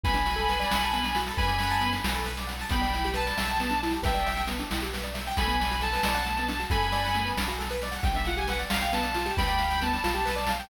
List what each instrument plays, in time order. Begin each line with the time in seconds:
0.03 synth bass 2 B1, acoustic grand piano B3, distortion guitar G#5 B5, kick, snare
0.14 acoustic grand piano D4, snare
0.26 acoustic grand piano F#4, snare
0.36 acoustic grand piano A4, snare
0.48 acoustic grand piano B4, snare
0.60 acoustic grand piano D5, snare
0.70 synth bass 2 B1, acoustic grand piano F#5, snare
0.81 acoustic grand piano A5, snare
0.93 acoustic grand piano B3, snare
1.03 acoustic grand piano D4, snare
1.15 acoustic grand piano F#4, snare
1.27 acoustic grand piano A4, snare
1.37 synth bass 2 F#2, acoustic grand piano B4, distortion guitar G#5 B5, kick, snare
1.47 acoustic grand piano D5, snare
1.59 acoustic grand piano F#5, snare
1.70 acoustic grand piano A5, snare
1.81 acoustic grand piano B3, snare
1.93 acoustic grand piano D4, snare
2.04 synth bass 2 B1, acoustic grand piano F#4, snare
2.14 acoustic grand piano A4, snare
2.24 acoustic grand piano B4, snare
2.37 acoustic grand piano D5, snare
2.47 acoustic grand piano F#5, snare
2.59 acoustic grand piano A5, snare
2.69 synth bass 2 B1, acoustic grand piano B3, distortion guitar G5 B5, kick, snare
2.81 acoustic grand piano D4, snare
2.93 acoustic grand piano E4, snare
3.04 acoustic grand piano G4, snare
3.14 acoustic grand piano B4, distortion guitar A5, snare
3.26 acoustic grand piano D5, snare
3.37 synth bass 2 B1, acoustic grand piano E5, snare
3.47 acoustic grand piano G5, snare
3.60 acoustic grand piano B3, snare
3.69 acoustic grand piano D4, snare
3.83 acoustic grand piano E4, snare
3.91 acoustic grand piano G4, snare
4.02 synth bass 2 B1, acoustic grand piano B4, distortion guitar E5 G5, kick, snare
4.14 acoustic grand piano D5, snare
4.26 acoustic grand piano E5, snare
4.36 acoustic grand piano G5, snare
4.47 acoustic grand piano B3, snare
4.59 acoustic grand piano D4, snare
4.70 synth bass 2 B1, acoustic grand piano E4, snare
4.80 acoustic grand piano G4, snare
4.93 acoustic grand piano B4, snare
5.03 acoustic grand piano D5, snare
5.14 acoustic grand piano E5, snare
5.26 acoustic grand piano G5, snare
5.37 synth bass 2 B1, acoustic grand piano A3, distortion guitar G#5 B5, kick, snare
5.47 acoustic grand piano B3, snare
5.60 acoustic grand piano D4, snare
5.71 acoustic grand piano F#4, snare
5.81 acoustic grand piano A4, distortion guitar A5, snare
5.92 acoustic grand piano B4, snare
6.03 synth bass 2 B1, acoustic grand piano D5, snare
6.14 acoustic grand piano F#5, snare
6.26 acoustic grand piano A3, snare
6.37 acoustic grand piano B3, snare
6.48 acoustic grand piano D4, snare
6.60 acoustic grand piano F#4, snare
6.70 synth bass 2 F#2, acoustic grand piano A4, distortion guitar G#5 B5, kick, snare
6.82 acoustic grand piano B4, snare
6.92 acoustic grand piano D5, snare
7.04 acoustic grand piano F#5, snare
7.14 acoustic grand piano A3, snare
7.25 acoustic grand piano B3, snare
7.37 synth bass 2 B1, acoustic grand piano D4, snare
7.48 acoustic grand piano F#4, snare
7.59 acoustic grand piano A4, snare
7.70 acoustic grand piano B4, snare
7.82 acoustic grand piano D5, snare
7.91 acoustic grand piano F#5, snare
8.03 synth bass 2 B1, acoustic grand piano B3, distortion guitar G5, kick, snare
8.14 acoustic grand piano D4, distortion guitar E5, snare
8.25 acoustic grand piano F4, distortion guitar F#5, snare
8.37 acoustic grand piano G4, distortion guitar G#5, snare
8.47 acoustic grand piano B4, distortion guitar F#5, snare
8.59 acoustic grand piano D5, snare
8.70 synth bass 2 B1, acoustic grand piano F5, distortion guitar F5, snare
8.81 acoustic grand piano G5, snare
8.93 acoustic grand piano B3, distortion guitar A5, snare
9.03 acoustic grand piano D4, snare
9.14 acoustic grand piano F4, snare
9.25 acoustic grand piano G4, snare
9.37 synth bass 2 D2, acoustic grand piano B4, distortion guitar G5 B5, kick, snare
9.48 acoustic grand piano D5, snare
9.58 acoustic grand piano F5, snare
9.70 acoustic grand piano G5, snare
9.81 acoustic grand piano B3, distortion guitar A5, snare
9.93 acoustic grand piano D4, snare
10.03 synth bass 2 B1, acoustic grand piano F4, snare
10.14 acoustic grand piano G4, snare
10.25 acoustic grand piano B4, snare
10.36 acoustic grand piano D5, snare
10.46 acoustic grand piano F5, snare
10.59 acoustic grand piano G5, snare